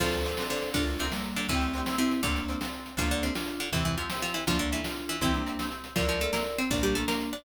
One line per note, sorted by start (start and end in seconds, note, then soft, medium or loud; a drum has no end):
0.00 0.33 D2 medium
0.00 0.46 F3 loud
0.00 0.23 C4 medium
0.00 0.23 D4 medium
0.00 0.46 F4 loud
0.00 0.23 F4 medium
0.00 0.44 A4 medium
0.00 0.44 C5 loud
0.00 kick loud
0.00 crash loud
0.04 0.23 A4 medium
0.12 closed hi-hat medium
0.25 0.36 C4 medium
0.25 0.36 D4 medium
0.25 0.36 F4 medium
0.25 closed hi-hat medium
0.29 0.36 A4 medium
0.37 0.72 C4 medium
0.37 0.72 D4 medium
0.37 0.72 F4 medium
0.37 snare loud
0.42 0.72 A4 medium
0.50 0.73 D3 medium
0.50 0.73 D4 loud
0.50 0.70 A4 medium
0.50 0.70 C5 medium
0.50 closed hi-hat medium
0.62 closed hi-hat medium
0.74 1.09 D2 medium
0.74 0.84 D3 loud
0.74 0.84 D4 loud
0.74 1.06 D4 medium
0.74 0.98 D4 medium
0.74 1.06 F4 loud
0.74 0.98 F4 medium
0.74 0.98 A4 loud
0.74 kick loud
0.74 closed hi-hat loud
0.79 0.98 A#4 medium
0.87 closed hi-hat medium
0.99 1.12 C3 medium
0.99 1.12 C4 medium
0.99 1.10 D4 medium
0.99 1.10 F4 medium
0.99 1.10 A4 medium
0.99 closed hi-hat medium
1.03 1.10 A#4 medium
1.12 1.48 G3 medium
1.12 1.48 A#3 medium
1.12 1.46 D4 medium
1.12 1.46 F4 medium
1.12 1.46 A4 medium
1.12 snare loud
1.16 1.46 A#4 medium
1.24 closed hi-hat medium
1.36 1.47 D3 medium
1.36 1.47 D4 loud
1.36 closed hi-hat medium
1.49 1.82 D2 medium
1.49 1.96 E3 loud
1.49 1.96 A3 medium
1.49 1.96 C4 loud
1.49 1.73 C4 medium
1.49 1.73 D4 medium
1.49 1.96 E4 loud
1.49 kick loud
1.49 closed hi-hat loud
1.53 1.73 E4 medium
1.53 1.73 G4 medium
1.62 closed hi-hat medium
1.73 1.85 C4 medium
1.73 1.85 D4 medium
1.73 1.85 E4 medium
1.73 closed hi-hat medium
1.78 1.85 G4 medium
1.86 2.20 C4 medium
1.86 2.20 D4 medium
1.86 2.20 E4 medium
1.86 snare loud
1.90 2.20 G4 medium
1.98 2.21 C3 medium
1.98 2.21 C4 loud
1.98 2.21 C4 medium
1.98 2.21 E4 loud
1.98 closed hi-hat medium
2.11 closed hi-hat medium
2.23 2.56 D2 medium
2.23 2.44 D3 loud
2.23 2.64 A#3 medium
2.23 2.46 C4 medium
2.23 2.44 D4 loud
2.23 2.64 D4 loud
2.23 2.46 D4 loud
2.23 2.46 F4 loud
2.23 kick loud
2.23 closed hi-hat loud
2.27 2.46 A4 medium
2.36 closed hi-hat medium
2.48 2.60 C4 medium
2.48 2.60 D4 medium
2.48 2.60 F4 medium
2.48 closed hi-hat medium
2.53 2.60 A4 medium
2.61 2.95 C4 medium
2.61 2.95 D4 medium
2.61 2.95 F4 medium
2.61 snare loud
2.65 2.95 A4 medium
2.73 closed hi-hat medium
2.86 closed hi-hat medium
2.97 3.31 D2 medium
2.97 3.08 F3 loud
2.97 3.31 A#3 loud
2.97 3.20 D4 medium
2.97 3.31 D4 loud
2.97 3.08 F4 loud
2.97 3.20 F4 loud
2.97 3.20 A4 medium
2.97 kick loud
2.97 closed hi-hat loud
3.11 3.23 D3 loud
3.11 3.23 D4 loud
3.11 closed hi-hat medium
3.23 3.34 C3 medium
3.23 3.34 C4 medium
3.23 3.34 D4 medium
3.23 3.34 F4 medium
3.23 3.34 A4 medium
3.23 closed hi-hat medium
3.34 3.69 D4 medium
3.34 3.68 D4 medium
3.34 3.68 F4 loud
3.34 3.69 F4 medium
3.34 3.69 A4 medium
3.34 snare loud
3.48 closed hi-hat medium
3.60 3.70 D3 medium
3.60 3.70 D4 medium
3.60 closed hi-hat medium
3.72 4.06 E2 medium
3.72 3.96 C3 loud
3.72 3.96 E3 loud
3.72 3.83 E3 medium
3.72 3.95 C4 medium
3.72 3.83 E4 loud
3.72 3.95 E4 medium
3.72 3.95 G4 medium
3.72 kick loud
3.72 closed hi-hat loud
3.85 3.95 E3 medium
3.85 3.95 E4 medium
3.85 closed hi-hat medium
3.98 4.09 F3 medium
3.98 4.09 C4 medium
3.98 4.09 E4 medium
3.98 4.09 F4 medium
3.98 4.09 G4 medium
3.98 closed hi-hat medium
4.10 4.44 C4 medium
4.10 4.44 E4 medium
4.10 4.44 G4 medium
4.10 snare loud
4.22 4.34 F3 medium
4.22 4.34 F4 loud
4.22 closed hi-hat medium
4.34 4.45 E3 medium
4.34 4.45 E4 medium
4.34 closed hi-hat medium
4.47 4.81 D2 medium
4.47 4.58 F3 loud
4.47 4.81 A#3 medium
4.47 4.81 D4 loud
4.47 4.71 D4 medium
4.47 4.58 F4 loud
4.47 4.71 F4 loud
4.47 4.71 A4 medium
4.47 kick loud
4.47 closed hi-hat loud
4.59 4.70 D3 medium
4.59 4.70 D4 loud
4.59 closed hi-hat medium
4.72 4.84 E3 medium
4.72 4.84 D4 medium
4.72 4.84 E4 loud
4.72 4.84 F4 medium
4.72 4.84 A4 medium
4.72 closed hi-hat medium
4.84 5.17 D4 medium
4.84 5.20 D4 medium
4.84 5.17 F4 medium
4.84 5.20 F4 medium
4.84 snare loud
4.89 5.20 A4 medium
4.97 closed hi-hat medium
5.09 5.21 E3 loud
5.09 5.21 E4 loud
5.09 closed hi-hat medium
5.21 5.55 C2 medium
5.21 5.42 E3 loud
5.21 5.44 C4 medium
5.21 5.32 C4 loud
5.21 5.32 E4 loud
5.21 5.42 E4 loud
5.21 5.44 E4 medium
5.21 5.44 G4 loud
5.21 kick loud
5.21 closed hi-hat loud
5.34 5.69 A#3 medium
5.34 5.69 D4 loud
5.34 closed hi-hat medium
5.46 5.58 C4 medium
5.46 5.58 E4 medium
5.46 5.58 G4 medium
5.46 closed hi-hat medium
5.59 5.94 C4 medium
5.59 5.94 E4 medium
5.59 5.94 G4 medium
5.59 snare loud
5.71 closed hi-hat medium
5.84 closed hi-hat medium
5.95 6.30 D2 medium
5.95 6.06 F3 medium
5.95 6.18 D4 medium
5.95 6.18 E4 medium
5.95 6.06 F4 loud
5.95 6.18 F4 medium
5.95 6.58 A#4 medium
5.95 6.58 D5 loud
5.95 kick loud
5.95 closed hi-hat loud
6.00 6.18 A4 medium
6.08 6.20 F3 medium
6.08 6.20 F4 loud
6.08 closed hi-hat medium
6.20 6.31 A3 medium
6.20 6.31 D4 medium
6.20 6.31 E4 medium
6.20 6.31 F4 medium
6.20 6.31 A4 loud
6.20 closed hi-hat medium
6.24 6.31 A4 medium
6.32 6.43 A#3 medium
6.32 6.67 D4 medium
6.32 6.67 E4 medium
6.32 6.67 F4 medium
6.32 6.43 A#4 medium
6.32 snare loud
6.37 6.67 A4 medium
6.46 closed hi-hat medium
6.58 6.70 C4 loud
6.58 6.70 C5 loud
6.58 closed hi-hat medium
6.70 7.04 A#1 medium
6.70 7.34 A#3 loud
6.70 7.34 D4 loud
6.70 6.83 D4 loud
6.70 6.94 D4 medium
6.70 6.94 F4 medium
6.70 6.94 A#4 medium
6.70 6.83 D5 loud
6.70 kick loud
6.70 closed hi-hat loud
6.83 6.95 G3 loud
6.83 6.95 G4 loud
6.83 closed hi-hat medium
6.95 7.06 A3 medium
6.95 7.07 D4 medium
6.95 7.07 F4 medium
6.95 7.06 A4 loud
6.95 7.07 A#4 medium
6.95 closed hi-hat medium
7.08 7.30 A#3 medium
7.08 7.42 D4 medium
7.08 7.42 F4 medium
7.08 7.30 A#4 loud
7.08 7.42 A#4 medium
7.08 snare loud
7.21 closed hi-hat medium
7.33 7.44 D4 medium
7.33 7.44 D5 medium
7.33 closed hi-hat medium